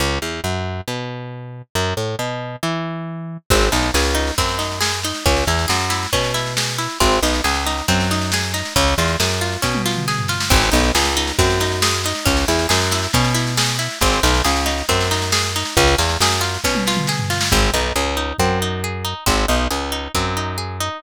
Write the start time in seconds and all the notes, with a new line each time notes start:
0.00 C#2
0.22 E2
0.44 F#2
0.88 B2
1.75 F#2
1.97 A2
2.19 B2
2.63 E3
3.50 G#1 C4, kick, snare, crash
3.61 snare
3.72 B1 D#4, snare
3.82 snare
3.94 C#2 G#4, snare
4.05 snare
4.15 D#4, snare
4.27 snare
4.38 F#2 C4, kick, snare
4.49 snare
4.59 D#4, snare
4.72 snare
4.81 G#4, snare
4.93 snare
5.03 D#4, snare
5.14 snare
5.26 C#2 C#4, kick, snare
5.36 snare
5.47 E2 E4, snare
5.59 snare
5.68 F#2 G#4, snare
5.80 snare
5.90 E4, snare
6.03 snare
6.13 B2 C#4, kick, snare
6.24 snare
6.34 E4, snare
6.46 snare
6.57 G#4, snare
6.68 snare
6.78 E4, snare
6.89 snare
7.00 G#1 C4, kick, snare
7.12 snare
7.23 B1 D#4, snare
7.34 snare
7.44 C#2 G#4, snare
7.54 snare
7.66 D#4, snare
7.77 snare
7.88 F#2 C4, kick, snare
8.00 snare
8.11 D#4, snare
8.21 snare
8.32 G#4, snare
8.43 snare
8.54 D#4, snare
8.65 snare
8.76 C#2 C#4, kick, snare
8.88 snare
8.98 E2 F4, snare
9.08 snare
9.20 F#2 G#4, snare
9.30 snare
9.41 F4, snare
9.52 snare
9.62 B2 C#4, kick, snare
9.75 high tom
9.86 F4, snare
9.96 mid tom
10.08 G#4, snare
10.19 floor tom
10.28 F4, snare
10.40 snare
10.50 G#1 C4, kick, snare, crash
10.63 snare
10.72 B1 D#4, snare
10.83 snare
10.95 C#2 G#4, snare
11.05 snare
11.17 D#4, snare
11.27 snare
11.39 F#2 C4, kick, snare
11.50 snare
11.60 D#4, snare
11.72 snare
11.82 G#4, snare
11.94 snare
12.04 D#4, snare
12.15 snare
12.25 C#2 C#4, kick, snare
12.37 snare
12.48 E2 E4, snare
12.59 snare
12.69 F#2 G#4, snare
12.81 snare
12.91 E4, snare
13.03 snare
13.13 B2 C#4, kick, snare
13.24 snare
13.34 E4, snare
13.47 snare
13.57 G#4, snare
13.68 snare
13.79 E4, snare
13.90 snare
14.01 G#1 C4, kick, snare
14.13 snare
14.23 B1 D#4, snare
14.34 snare
14.45 C#2 G#4, snare
14.56 snare
14.66 D#4, snare
14.78 snare
14.89 F#2 C4, kick, snare
15.01 snare
15.11 D#4, snare
15.22 snare
15.32 G#4, snare
15.43 snare
15.56 D#4, snare
15.65 snare
15.77 C#2 C#4, kick, snare
15.87 snare
15.98 E2 F4, snare
16.09 snare
16.20 F#2 G#4, snare
16.31 snare
16.41 F4, snare
16.54 snare
16.64 B2 C#4, kick, snare
16.75 high tom
16.87 F4, snare
16.97 mid tom
17.07 G#4, snare
17.19 floor tom
17.30 F4, snare
17.41 snare
17.52 G#1 C4, kick
17.74 B1 D#4
17.96 C#2 G#4
18.17 D#4
18.39 F#2 C4, kick
18.62 D#4
18.84 G#4
19.05 D#4
19.26 G#1 C4, kick
19.48 B1 D#4
19.71 C#2 G#4
19.92 D#4
20.15 F#2 C4, kick
20.37 D#4
20.58 G#4
20.80 D#4